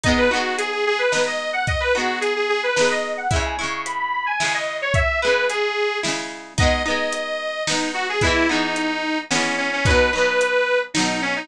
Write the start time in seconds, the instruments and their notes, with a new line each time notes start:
0.04 acoustic guitar (steel) B3 D#4, accordion D#5, kick, closed hi-hat
0.09 acoustic guitar (steel) G#3
0.18 accordion B4
0.30 acoustic guitar (steel) B3 D#4, accordion F#4
0.36 acoustic guitar (steel) G#3
0.58 accordion G#4, closed hi-hat
0.72 accordion G#4
0.87 accordion G#4
0.99 accordion B4
1.12 acoustic guitar (steel) B3 D#4, snare
1.17 acoustic guitar (steel) G#3
1.27 accordion D#5
1.53 accordion F#5
1.67 accordion D#5, kick, closed hi-hat
1.80 accordion B4
1.95 acoustic guitar (steel) B3 D#4, accordion F#4
2.00 acoustic guitar (steel) G#3
2.21 accordion G#4, closed hi-hat
2.36 accordion G#4
2.49 accordion G#4
2.63 accordion B4
2.76 acoustic guitar (steel) B3 D#4, snare
2.81 acoustic guitar (steel) G#3
2.91 accordion D#5
3.17 accordion F#5
3.30 acoustic guitar (steel) G#3 E4, accordion E5, kick, closed hi-hat
3.36 acoustic guitar (steel) C#3
3.45 accordion G#5
3.58 acoustic guitar (steel) G#3 E4, accordion C#6
3.63 acoustic guitar (steel) C#3
3.85 accordion B5, closed hi-hat
3.99 accordion B5
4.13 accordion B5
4.26 accordion G#5
4.40 acoustic guitar (steel) G#3 E4, snare
4.45 acoustic guitar (steel) C#3
4.54 accordion D#5
4.82 accordion C#5
4.94 accordion E5, kick, closed hi-hat
5.22 acoustic guitar (steel) G#3 E4, accordion B4
5.27 acoustic guitar (steel) C#3
5.50 accordion G#4, closed hi-hat
6.03 acoustic guitar (steel) G#3 E4, snare
6.08 acoustic guitar (steel) C#3
6.58 acoustic guitar (steel) B3 D#4, accordion D#5, kick, closed hi-hat
6.63 acoustic guitar (steel) G#3
6.85 acoustic guitar (steel) B3 D#4, accordion D#5
6.90 acoustic guitar (steel) G#3
7.13 closed hi-hat
7.67 acoustic guitar (steel) B3 D#4, accordion D#4, snare
7.72 acoustic guitar (steel) G#3
7.94 accordion F#4
8.09 accordion G#4
8.21 acoustic guitar (steel) G#3 B3, accordion E4, kick, closed hi-hat
8.27 acoustic guitar (steel) E3
8.49 acoustic guitar (steel) G#3 B3, accordion D#4
8.54 acoustic guitar (steel) E3
8.76 closed hi-hat
9.31 acoustic guitar (steel) G#3 B3, accordion C#4, snare
9.35 acoustic guitar (steel) E3
9.57 accordion C#4
9.73 accordion C#4
9.85 acoustic guitar (steel) F#3 D#4, accordion B4, kick, closed hi-hat
9.90 acoustic guitar (steel) B2
10.12 acoustic guitar (steel) F#3 D#4, accordion B4
10.18 acoustic guitar (steel) B2
10.41 closed hi-hat
10.94 acoustic guitar (steel) F#3 D#4, accordion D#4, snare
10.99 acoustic guitar (steel) B2
11.22 accordion C#4
11.36 accordion D#4